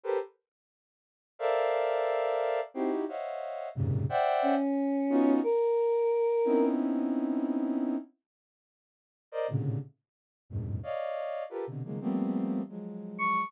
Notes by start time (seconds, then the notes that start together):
0.04 G4 A4 A#4 B4 C5
1.39 A4 A#4 C5 D5 E5 F5
2.74 C4 D#4 E4 F#4 G4
3.08 C5 C#5 D#5 E5 F5 F#5
3.75 F2 F#2 G#2 A#2 C3 C#3
4.09 C5 D5 E5 F#5 G5
4.42 C#4
5.10 B3 C#4 D#4 F4 F#4
5.43 A#4
6.45 B3 C4 C#4 D#4 E4
9.32 A#4 C5 D5 D#5
9.48 A2 A#2 C3 C#3 D3
10.50 E2 F#2 G2 G#2 A2 B2
10.83 C#5 D5 D#5 F5
11.50 F4 G4 A4 A#4 B4
11.67 B2 C3 D3
11.84 C#3 D#3 F3 F#3 G#3 A#3
12.01 F3 G3 A3 A#3 B3 C4
12.69 F3 F#3 G#3
13.19 C#6